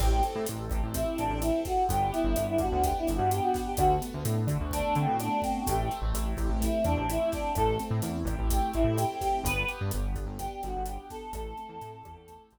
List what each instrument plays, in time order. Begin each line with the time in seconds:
0.00 synth bass 1 A1, acoustic grand piano C4, choir aahs G4, kick, cross-stick, crash
0.23 acoustic grand piano A4, closed hi-hat
0.35 synth bass 1 A2
0.46 synth bass 1 A1, acoustic grand piano C4, closed hi-hat
0.70 synth bass 1 A1, acoustic grand piano G4, kick, cross-stick, closed hi-hat
0.83 synth bass 1 A1
0.94 acoustic grand piano C4, choir aahs E4, kick, closed hi-hat
1.18 synth bass 1 A1, choir aahs D4, acoustic grand piano A4, closed hi-hat
1.30 synth bass 1 A1
1.41 choir aahs E4, acoustic grand piano G4, cross-stick, closed hi-hat
1.65 acoustic grand piano C4, choir aahs F#4, kick, snare, closed hi-hat
1.89 synth bass 1 G1, acoustic grand piano B3, choir aahs G4, kick, closed hi-hat
2.12 choir aahs E4, acoustic grand piano G4, closed hi-hat
2.24 synth bass 1 G1
2.36 synth bass 1 G1, acoustic grand piano B3, cross-stick, closed hi-hat
2.48 choir aahs E4
2.58 synth bass 1 G2, acoustic grand piano D4, choir aahs F#4, kick, closed hi-hat
2.72 synth bass 1 D2
2.82 acoustic grand piano B3, choir aahs G4, kick, closed hi-hat
2.99 choir aahs E4
3.07 synth bass 1 G1, acoustic grand piano G4, cross-stick, closed hi-hat
3.15 choir aahs F#4
3.19 synth bass 1 G2
3.31 acoustic grand piano D4, choir aahs G4, closed hi-hat
3.42 choir aahs F#4
3.54 acoustic grand piano B3, kick, snare, closed hi-hat
3.66 choir aahs G4
3.77 synth bass 1 D2, acoustic grand piano A3, choir aahs F#4, kick, cross-stick, closed hi-hat
4.01 acoustic grand piano B3, closed hi-hat
4.14 synth bass 1 D2
4.25 synth bass 1 A2, acoustic grand piano D4, closed hi-hat
4.47 synth bass 1 D3, acoustic grand piano F#4, kick, cross-stick, closed hi-hat
4.61 synth bass 1 D2
4.71 acoustic grand piano A3, choir aahs D4, kick, closed hi-hat
4.95 synth bass 1 D3, acoustic grand piano B3, choir aahs C4, closed hi-hat
5.08 synth bass 1 A2
5.20 choir aahs D4, acoustic grand piano D4, cross-stick, closed hi-hat
5.42 choir aahs C4, acoustic grand piano F#4, kick, snare, closed hi-hat
5.67 synth bass 1 A1, acoustic grand piano A3, choir aahs G4, kick, closed hi-hat
5.90 acoustic grand piano C4, closed hi-hat
6.02 synth bass 1 A1
6.13 synth bass 1 A1, acoustic grand piano E4, cross-stick, closed hi-hat
6.37 synth bass 1 A1, acoustic grand piano G4, kick, closed hi-hat
6.49 synth bass 1 A1
6.61 acoustic grand piano A3, choir aahs E4, kick, closed hi-hat
6.84 synth bass 1 E2, acoustic grand piano C4, choir aahs D4, cross-stick, closed hi-hat
6.97 synth bass 1 A1
7.09 choir aahs E4, acoustic grand piano E4, closed hi-hat
7.32 choir aahs D4, acoustic grand piano G4, kick, snare, closed hi-hat
7.55 synth bass 1 A1, acoustic grand piano A3, choir aahs A4, kick, cross-stick, closed hi-hat
7.79 acoustic grand piano C4, closed hi-hat
7.91 synth bass 1 A2
8.02 synth bass 1 E2, acoustic grand piano E4, closed hi-hat
8.25 synth bass 1 A1, acoustic grand piano G4, kick, cross-stick, closed hi-hat
8.39 synth bass 1 A1
8.50 acoustic grand piano A3, choir aahs G4, kick, closed hi-hat
8.74 synth bass 1 A1, acoustic grand piano C4, choir aahs E4, closed hi-hat
8.84 synth bass 1 A2
8.98 acoustic grand piano E4, choir aahs G4, cross-stick, closed hi-hat
9.21 acoustic grand piano G4, choir aahs G4, kick, snare, closed hi-hat
9.44 synth bass 1 G1, acoustic grand piano B3, choir aahs B4, kick, closed hi-hat
9.68 acoustic grand piano G4, closed hi-hat
9.81 synth bass 1 G2
9.91 synth bass 1 G1, acoustic grand piano B3, cross-stick, closed hi-hat
10.16 synth bass 1 G1, acoustic grand piano D4, kick, closed hi-hat
10.26 synth bass 1 G1
10.39 acoustic grand piano B3, choir aahs G4, kick, closed hi-hat
10.62 synth bass 1 G1, choir aahs F#4, acoustic grand piano G4, cross-stick, closed hi-hat
10.77 synth bass 1 G1
10.86 acoustic grand piano D4, choir aahs G4, closed hi-hat
11.10 acoustic grand piano B3, choir aahs A4, kick, snare, closed hi-hat
11.33 synth bass 1 A1, acoustic grand piano A3, choir aahs A4, kick, cross-stick, closed hi-hat
11.57 acoustic grand piano C4, closed hi-hat
11.69 synth bass 1 E2
11.81 synth bass 1 A2, acoustic grand piano E4, closed hi-hat
12.04 synth bass 1 E2, acoustic grand piano G4, kick, cross-stick, closed hi-hat
12.16 synth bass 1 E2
12.28 acoustic grand piano A3, kick, closed hi-hat
12.50 synth bass 1 A1, acoustic grand piano C4, closed hi-hat